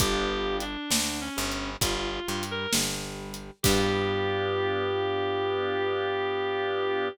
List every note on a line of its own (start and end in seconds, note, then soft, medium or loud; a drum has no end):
0.00 0.77 G1 loud
0.00 0.64 B3 loud
0.00 0.64 D4 medium
0.00 0.64 F4 medium
0.00 0.57 G4 loud
0.00 0.64 G4 medium
0.00 kick loud
0.00 closed hi-hat loud
0.60 1.20 D4 medium
0.60 closed hi-hat medium
0.91 1.29 D2 medium
0.91 1.30 D3 medium
0.91 snare loud
1.21 1.70 C#4 medium
1.37 1.77 G1 loud
1.37 1.75 G3 medium
1.52 closed hi-hat medium
1.81 2.20 G1 loud
1.81 2.20 G3 medium
1.81 2.44 F4 medium
1.81 kick medium
1.81 closed hi-hat loud
2.27 2.67 G2 medium
2.27 2.66 G3 medium
2.43 closed hi-hat medium
2.51 2.73 A#4 medium
2.73 3.51 G1 medium
2.73 3.50 G3 medium
2.73 snare loud
3.34 closed hi-hat medium
3.63 7.10 G2 loud
3.63 7.08 B3 loud
3.63 7.08 D4 medium
3.63 7.08 F4 loud
3.63 7.08 G4 loud
3.63 kick loud
3.63 crash loud